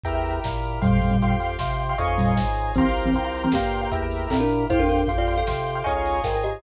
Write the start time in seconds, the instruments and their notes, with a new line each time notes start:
0.04 drawbar organ E2 E4 G4, acoustic grand piano E5 G5 A#5, kick, closed hi-hat
0.08 drawbar organ A#4
0.15 acoustic grand piano E5 G5 A#5
0.25 open hi-hat
0.44 drawbar organ A#2, kick, snare
0.63 open hi-hat
0.82 drawbar organ F2 F4 G4 C5, kalimba A#2 G3, acoustic grand piano F5 G5 C6, kick, closed hi-hat
1.01 kalimba A#2 G3, open hi-hat
1.11 kalimba A#2 G3
1.22 drawbar organ F2, acoustic grand piano F5 G5 C6, kick, closed hi-hat
1.30 acoustic grand piano F5 G5 C6
1.40 acoustic grand piano F5 G5 C6, open hi-hat
1.49 acoustic grand piano F5 G5 C6
1.59 drawbar organ C3, acoustic grand piano F5 G5 C6, kick, snare
1.80 open hi-hat
1.89 acoustic grand piano F5 G5 C6
1.98 drawbar organ F2 D#4 F4 G#4 C#5, acoustic grand piano D#5 F5 G#5 C#6, kick, closed hi-hat
2.08 acoustic grand piano D#5 F5 G#5 C#6
2.18 kalimba A#2 G3, open hi-hat
2.37 drawbar organ G#2, kick, snare
2.55 open hi-hat
2.75 drawbar organ C2 F4 G4 A#4, kalimba E3 C4, acoustic grand piano F5 G5 A#5 C6, kick, closed hi-hat
2.79 drawbar organ C5
2.96 open hi-hat
3.05 kalimba E3 C4
3.14 drawbar organ C2, acoustic grand piano F5 G5 A#5 C6, kick, closed hi-hat
3.24 acoustic grand piano F5 G5 A#5 C6
3.34 acoustic grand piano F5 G5 A#5 C6, open hi-hat
3.43 kalimba E3 C4, acoustic grand piano F5 G5 A#5 C6
3.52 drawbar organ G2, kalimba A#3 G4, acoustic grand piano F5 G5 A#5 C6, kick, snare
3.73 open hi-hat
3.81 acoustic grand piano F5 G5 A#5 C6
3.92 drawbar organ E2 E4 G4 A#4, acoustic grand piano E5 G5 A#5, kick, closed hi-hat
4.03 acoustic grand piano E5 G5 A#5
4.11 open hi-hat
4.30 drawbar organ A#2, kalimba C4 A4, kick, clap
4.40 kalimba D4 A#4
4.49 open hi-hat
4.70 drawbar organ F2 F4 G4 C5, kalimba E4 C5, acoustic grand piano F5 G5 C6, kick, closed hi-hat
4.79 kalimba D4 A#4
4.89 kalimba D4 A#4, open hi-hat
5.07 drawbar organ F2, acoustic grand piano F5 G5 C6, kick, closed hi-hat
5.18 kalimba F4 D5, acoustic grand piano F5 G5 C6
5.27 acoustic grand piano F5 G5 C6, open hi-hat
5.37 kalimba A4 F5, acoustic grand piano F5 G5 C6
5.47 drawbar organ C3, acoustic grand piano F5 G5 C6, kick, snare
5.66 open hi-hat
5.75 acoustic grand piano F5 G5 C6
5.84 drawbar organ C#2 D#4 F4 G#4, acoustic grand piano D#5 F5 G#5 C#6, kick, closed hi-hat
5.89 drawbar organ C#5
5.95 acoustic grand piano D#5 F5 G#5 C#6
6.06 open hi-hat
6.24 drawbar organ G#2, kalimba A#4 G5, kick, snare
6.34 kalimba A#4 G5
6.43 kalimba G4 D#5, open hi-hat